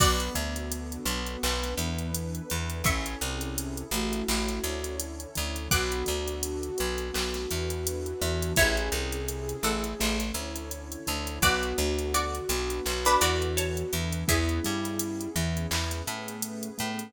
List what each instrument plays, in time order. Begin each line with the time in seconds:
0.00 electric bass (finger) B1, acoustic grand piano B3, pad 2 (warm) B3 D4 F#4 A4, flute B3, pizzicato strings F#4 D5, kick, crash
0.20 closed hi-hat
0.35 electric bass (finger) D2, acoustic grand piano D3, closed hi-hat
0.56 closed hi-hat
0.72 closed hi-hat
0.92 closed hi-hat
1.06 electric bass (finger) B1, acoustic grand piano B3, closed hi-hat
1.26 closed hi-hat
1.43 electric bass (finger) B1, pad 2 (warm) B3 D4 A4 B4, acoustic grand piano B3, clap
1.63 snare, closed hi-hat
1.78 electric bass (finger) E2, acoustic grand piano E3, closed hi-hat
1.99 closed hi-hat
2.14 closed hi-hat
2.35 closed hi-hat
2.50 electric bass (finger) E2, acoustic grand piano E3, closed hi-hat
2.70 closed hi-hat
2.84 electric bass (finger) A1, acoustic grand piano C#4, flute C#4, pad 2 (warm) C#4 E4 G#4 A4, pizzicato strings E5 C#6, kick, closed hi-hat
3.06 closed hi-hat
3.21 electric bass (finger) C2, acoustic grand piano C3, closed hi-hat
3.41 closed hi-hat
3.58 closed hi-hat
3.77 closed hi-hat
3.91 electric bass (finger) A1, acoustic grand piano A3, flute F#4, closed hi-hat
4.13 closed hi-hat
4.28 electric bass (finger) A1, acoustic grand piano A3, pad 2 (warm) C#4 E4 A4 C#5, clap
4.49 snare, closed hi-hat
4.64 electric bass (finger) D2, acoustic grand piano D3, closed hi-hat
4.84 closed hi-hat
5.00 closed hi-hat
5.20 closed hi-hat
5.35 electric bass (finger) D2, acoustic grand piano D3, closed hi-hat
5.56 closed hi-hat
5.71 electric bass (finger) B1, acoustic grand piano B3, pad 2 (warm) B3 D4 F#4 A4, flute F#4, pizzicato strings F#5 D6, kick, closed hi-hat
5.92 closed hi-hat
6.06 electric bass (finger) D2, acoustic grand piano D3, closed hi-hat
6.28 closed hi-hat
6.43 closed hi-hat
6.63 closed hi-hat
6.78 electric bass (finger) B1, acoustic grand piano B3, closed hi-hat
6.98 closed hi-hat
7.14 electric bass (finger) B1, acoustic grand piano B3, pad 2 (warm) B3 D4 A4 B4, clap
7.34 snare, closed hi-hat
7.50 electric bass (finger) E2, acoustic grand piano E3, closed hi-hat
7.70 closed hi-hat
7.87 closed hi-hat
8.06 closed hi-hat
8.22 electric bass (finger) E2, acoustic grand piano E3, snare, closed hi-hat
8.42 closed hi-hat
8.56 electric bass (finger) A1, pad 2 (warm) C#4 E4 G#4 A4, acoustic grand piano C#4, pizzicato strings E4 C#5, flute G#4, kick, closed hi-hat
8.77 closed hi-hat
8.92 electric bass (finger) C2, acoustic grand piano C3, closed hi-hat
9.12 closed hi-hat
9.28 closed hi-hat
9.49 closed hi-hat
9.63 electric bass (finger) A1, acoustic grand piano A3, pizzicato strings A4 F#5, closed hi-hat
9.84 closed hi-hat
10.00 electric bass (finger) A1, acoustic grand piano A3, pad 2 (warm) C#4 E4 A4 C#5, clap
10.20 snare, closed hi-hat
10.34 electric bass (finger) D2, acoustic grand piano D3, closed hi-hat
10.56 closed hi-hat
10.71 closed hi-hat
10.92 closed hi-hat
11.07 electric bass (finger) D2, acoustic grand piano D3, closed hi-hat
11.27 closed hi-hat
11.42 electric bass (finger) B1, pad 2 (warm) B3 D4 F#4 A4, acoustic grand piano B3, pizzicato strings F#4 D5, flute F#4, kick, closed hi-hat
11.63 closed hi-hat
11.78 electric bass (finger) D2, acoustic grand piano D3, closed hi-hat
11.99 closed hi-hat
12.14 pizzicato strings F#4 D5, closed hi-hat
12.35 closed hi-hat
12.49 electric bass (finger) B1, acoustic grand piano B3, closed hi-hat
12.70 closed hi-hat
12.85 electric bass (finger) B1, pad 2 (warm) B3 D4 A4 B4, acoustic grand piano B3, clap
13.05 pizzicato strings D4 B4, snare, closed hi-hat
13.21 electric bass (finger) E2, acoustic grand piano E3, pizzicato strings F#4 D5, closed hi-hat
13.42 closed hi-hat
13.57 pizzicato strings C#5 A5, closed hi-hat
13.77 closed hi-hat
13.93 electric bass (finger) E2, acoustic grand piano E3, closed hi-hat
14.13 closed hi-hat
14.28 electric bass (finger) E2, acoustic grand piano B3, pad 2 (warm) B3 C#4 E4 G#4, flute E4, pizzicato strings G#4 E5, kick, closed hi-hat
14.49 closed hi-hat
14.64 electric bass (finger) G2, acoustic grand piano G3, closed hi-hat
14.84 snare, closed hi-hat
14.99 closed hi-hat
15.21 closed hi-hat
15.35 electric bass (finger) E2, acoustic grand piano E3, closed hi-hat
15.57 closed hi-hat
15.71 electric bass (finger) E2, acoustic grand piano E3, pad 2 (warm) B3 C#4 G#4 B4, clap
15.91 snare, closed hi-hat
16.06 electric bass (finger) A2, acoustic grand piano A3, closed hi-hat
16.28 closed hi-hat
16.42 closed hi-hat
16.63 closed hi-hat
16.78 electric bass (finger) A2, acoustic grand piano A3, closed hi-hat
16.99 closed hi-hat